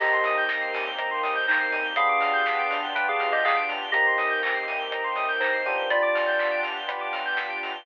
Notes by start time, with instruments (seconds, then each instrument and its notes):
0.00 synth bass 2 C2, electric piano 1 A#3 C4 D#4 G4, pad 5 (bowed) A#3 C4 D#4 G4, electric piano 2 G4 D#5, lead 1 (square) A#5, kick, crash
0.13 lead 1 (square) C6
0.24 synth bass 2 C3, lead 1 (square) D#6, open hi-hat
0.38 lead 1 (square) G6
0.49 synth bass 2 C2, lead 1 (square) A#6, kick, snare
0.61 lead 1 (square) C7
0.73 synth bass 2 C3, lead 1 (square) D#7, open hi-hat
0.86 lead 1 (square) G7
0.98 synth bass 2 C2, electric piano 1 A#3 C4 D#4 G4, lead 1 (square) A#5, kick, closed hi-hat
1.11 lead 1 (square) C6
1.23 synth bass 2 C3, lead 1 (square) D#6, open hi-hat
1.35 lead 1 (square) G6
1.47 synth bass 2 C2, electric piano 2 D#4 C5, lead 1 (square) A#6, kick, clap
1.60 lead 1 (square) C7
1.71 synth bass 2 G1, lead 1 (square) D#7, open hi-hat
1.84 lead 1 (square) G7
1.96 electric piano 1 B3 D4 F4 G4, pad 5 (bowed) B3 D4 F4 G4, electric piano 2 G#4 F5, lead 1 (square) B5, kick, closed hi-hat
2.09 lead 1 (square) D6
2.19 synth bass 2 G2, lead 1 (square) F6, open hi-hat
2.33 lead 1 (square) G6
2.46 synth bass 2 G1, lead 1 (square) B6, kick, snare
2.59 lead 1 (square) D7
2.71 synth bass 2 G2, lead 1 (square) F7, open hi-hat
2.83 lead 1 (square) G7
2.95 synth bass 2 G1, electric piano 1 B3 D4 F4 G4, electric piano 2 B4 G5, lead 1 (square) B5, kick, closed hi-hat
3.08 electric piano 2 G#4 F5, lead 1 (square) D6
3.20 synth bass 2 G2, lead 1 (square) F6, open hi-hat
3.32 electric piano 2 G4 D#5, lead 1 (square) G6
3.44 synth bass 2 G1, electric piano 2 G#4 F5, lead 1 (square) B6, kick, clap
3.57 lead 1 (square) D7
3.68 synth bass 2 G2, lead 1 (square) F7, open hi-hat
3.82 lead 1 (square) G7
3.92 synth bass 2 C2, pad 5 (bowed) A#3 C4 D#4 G4, electric piano 1 A#3 C4 D#4 G4, electric piano 2 G4 D#5, lead 1 (square) A#5, kick, closed hi-hat
4.06 lead 1 (square) C6
4.17 synth bass 2 C3, lead 1 (square) D#6, open hi-hat
4.30 lead 1 (square) G6
4.42 synth bass 2 C2, lead 1 (square) A#6, kick, clap
4.55 lead 1 (square) C7
4.67 synth bass 2 C3, lead 1 (square) D#7, open hi-hat
4.79 lead 1 (square) G7
4.91 synth bass 2 C2, electric piano 1 A#3 C4 D#4 G4, lead 1 (square) A#5, kick, closed hi-hat
5.04 lead 1 (square) C6
5.16 synth bass 2 C3, lead 1 (square) D#6, open hi-hat
5.29 lead 1 (square) G6
5.40 synth bass 2 C2, electric piano 2 D#4 C5, lead 1 (square) A#6, kick, clap
5.53 lead 1 (square) C7
5.66 synth bass 2 C3, electric piano 1 B3 D4 F4 G4, lead 1 (square) D#7, open hi-hat
5.78 lead 1 (square) G7
5.90 pad 5 (bowed) B3 D4 F4 G4, electric piano 2 F4 D5, lead 1 (square) B5, kick, closed hi-hat
6.02 lead 1 (square) D6
6.15 lead 1 (square) F6, open hi-hat
6.27 lead 1 (square) G6
6.39 lead 1 (square) B6, kick, clap
6.51 lead 1 (square) D7
6.63 lead 1 (square) F7, open hi-hat
6.76 lead 1 (square) G7
6.88 electric piano 1 B3 D4 F4 G4, lead 1 (square) B5, kick, closed hi-hat
7.01 lead 1 (square) D6
7.13 lead 1 (square) F6, open hi-hat
7.26 lead 1 (square) G6
7.37 lead 1 (square) B6, kick, snare
7.50 lead 1 (square) D7
7.63 lead 1 (square) F7, open hi-hat
7.74 lead 1 (square) G7